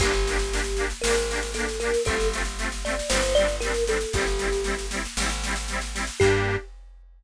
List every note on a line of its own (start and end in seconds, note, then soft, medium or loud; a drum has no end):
0.00 0.93 G1 medium
0.00 0.12 A#3 loud
0.00 0.12 D4 loud
0.00 0.85 G4 loud
0.00 kick loud
0.00 snare medium
0.00 crash loud
0.06 0.12 G4 loud
0.13 snare medium
0.27 0.37 A#3 medium
0.27 0.37 D4 medium
0.27 0.37 G4 loud
0.27 snare loud
0.39 snare medium
0.52 0.62 A#3 medium
0.52 0.62 D4 medium
0.52 0.62 G4 medium
0.52 snare loud
0.64 snare medium
0.77 0.87 A#3 medium
0.77 0.87 D4 medium
0.77 snare medium
0.81 0.87 G4 medium
0.90 snare medium
1.02 1.97 G#1 medium
1.02 1.15 A#3 medium
1.02 1.51 A#4 medium
1.02 snare loud
1.07 1.15 D4 medium
1.07 1.15 G4 medium
1.15 snare medium
1.30 1.41 A#3 medium
1.30 1.41 D4 medium
1.30 1.41 G4 medium
1.30 snare loud
1.43 snare medium
1.54 1.66 A#3 medium
1.54 1.66 D4 loud
1.54 1.79 A4 medium
1.54 snare loud
1.60 1.66 G4 medium
1.69 snare medium
1.80 1.91 A#3 medium
1.80 1.91 D4 medium
1.80 2.02 A#4 medium
1.80 snare medium
1.85 1.91 G4 medium
1.94 snare medium
2.05 3.02 G1 medium
2.05 2.17 A3 loud
2.05 2.17 C4 loud
2.05 2.28 A4 medium
2.05 kick loud
2.05 snare medium
2.10 2.17 F4 loud
2.20 snare medium
2.32 2.43 A3 medium
2.32 2.43 C4 medium
2.32 2.43 F4 medium
2.32 snare loud
2.45 snare medium
2.58 2.69 A3 medium
2.58 2.69 C4 medium
2.58 2.69 F4 medium
2.58 snare medium
2.72 snare medium
2.85 2.95 A3 medium
2.85 2.95 C4 medium
2.85 2.95 F4 medium
2.85 3.09 D5 medium
2.85 snare medium
2.99 snare loud
3.10 4.05 G1 medium
3.10 3.21 G3 loud
3.10 3.21 C4 loud
3.10 3.34 C5 medium
3.10 snare loud
3.15 3.21 D4 loud
3.23 snare loud
3.35 3.47 G3 medium
3.35 3.47 C4 medium
3.35 3.56 D5 medium
3.35 snare medium
3.40 3.47 D4 medium
3.48 snare medium
3.60 3.73 G3 medium
3.60 3.73 C4 medium
3.60 3.84 A#4 medium
3.60 snare loud
3.66 3.73 D4 medium
3.74 snare medium
3.87 3.98 G3 medium
3.87 3.98 C4 medium
3.87 3.98 D4 medium
3.87 4.13 A4 medium
3.87 snare loud
4.01 snare medium
4.13 5.07 G1 medium
4.13 4.25 G3 loud
4.13 4.25 C4 loud
4.13 4.85 G4 medium
4.13 kick loud
4.13 snare loud
4.19 4.25 E4 loud
4.27 snare medium
4.39 4.49 G3 medium
4.39 4.49 C4 medium
4.39 4.49 E4 medium
4.39 snare medium
4.52 snare medium
4.64 4.75 G3 medium
4.64 4.75 C4 medium
4.64 snare loud
4.68 4.75 E4 medium
4.79 snare medium
4.91 5.02 G3 medium
4.91 5.02 C4 medium
4.91 snare loud
4.95 5.02 E4 medium
5.05 snare medium
5.17 6.10 G#1 medium
5.17 5.29 G3 medium
5.17 5.29 C4 medium
5.17 snare loud
5.23 5.29 E4 medium
5.29 snare medium
5.44 5.55 G3 medium
5.44 5.55 C4 medium
5.44 snare loud
5.48 5.55 E4 medium
5.56 snare loud
5.68 5.80 G3 medium
5.68 5.80 C4 medium
5.68 snare medium
5.73 5.80 E4 medium
5.81 snare medium
5.94 6.05 G3 medium
5.94 6.05 C4 medium
5.94 6.05 E4 medium
5.94 snare loud
6.07 snare medium
6.20 6.57 G2 medium
6.20 6.56 A#3 medium
6.20 6.56 D4 loud
6.20 6.56 G4 loud
6.20 kick loud
6.20 crash loud
6.24 6.56 G4 loud